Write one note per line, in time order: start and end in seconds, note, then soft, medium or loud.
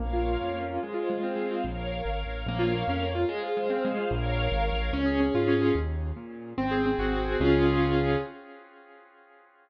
0.00 0.37 A#1 medium
0.00 0.25 A#3 medium
0.00 0.81 A#4 medium
0.00 0.81 C#5 medium
0.00 0.81 F5 medium
0.13 0.69 F4 medium
0.26 0.53 A#3 medium
0.40 0.78 F2 medium
0.40 0.79 C#4 medium
0.54 0.80 A#3 medium
0.70 0.83 F4 medium
0.82 1.09 G#3 medium
0.82 1.63 G#4 medium
0.82 1.63 C5 medium
0.82 1.63 F5 medium
0.94 1.51 F4 medium
1.10 1.35 G#3 medium
1.23 1.62 C4 medium
1.35 1.61 G#3 medium
1.51 1.64 F4 medium
1.64 2.01 A#1 medium
1.64 2.45 A#4 loud
1.64 2.45 C#5 medium
1.64 2.45 F5 medium
2.05 2.24 G#1 medium
2.26 2.45 A1 medium
2.46 2.83 A#1 loud
2.46 2.62 A#3 loud
2.46 3.28 A#4 loud
2.46 3.28 C#5 loud
2.46 3.28 F5 loud
2.59 2.73 F4 medium
2.75 2.88 A#3 medium
2.88 3.25 F2 medium
2.88 3.03 C#4 medium
3.02 3.16 A#3 medium
3.15 3.28 F4 medium
3.29 3.43 G#3 loud
3.29 4.12 G#4 medium
3.29 4.12 C5 loud
3.29 4.10 F5 loud
3.43 3.57 F4 medium
3.57 3.71 G#3 loud
3.70 3.84 C4 medium
3.85 3.98 G#3 loud
3.97 4.10 F4 medium
4.10 4.48 A#1 loud
4.10 4.91 A#4 loud
4.10 4.91 C#5 loud
4.10 4.91 F5 loud
4.52 4.70 G#1 medium
4.73 4.91 A1 medium
4.93 5.30 C#2 medium
4.93 5.20 C#4 loud
5.06 5.61 G#4 medium
5.20 5.47 C#4 medium
5.34 5.71 G#2 medium
5.34 5.74 F4 medium
5.48 5.74 C#4 loud
5.62 5.75 G#4 medium
5.75 6.12 D#2 medium
6.16 6.53 A#2 medium
6.58 6.95 G#1 medium
6.58 6.85 C4 loud
6.71 7.25 G#4 medium
6.86 7.11 C4 medium
6.99 7.36 G#1 medium
6.99 7.38 F#4 medium
7.12 7.38 C4 medium
7.25 7.38 G#4 medium
7.40 8.16 C#2 loud
7.40 8.17 C#4 loud
7.40 8.17 F4 loud
7.40 8.17 G#4 loud